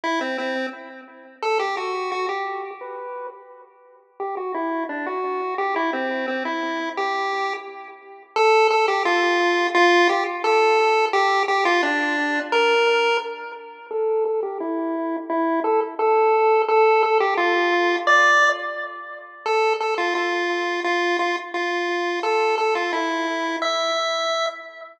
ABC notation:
X:1
M:4/4
L:1/8
Q:1/4=173
K:Em
V:1 name="Lead 1 (square)"
E C C2 z4 | A G F2 F G3 | B3 z5 | G F E2 D F3 |
G E C2 C E3 | G4 z4 | [K:Dm] A2 A G F4 | F2 G z A4 |
G2 G F D4 | B4 z4 | A2 A G E4 | E2 A z A4 |
A2 A G F4 | d3 z5 | A2 A F F4 | F2 F z F4 |
A2 A F E4 | e6 z2 |]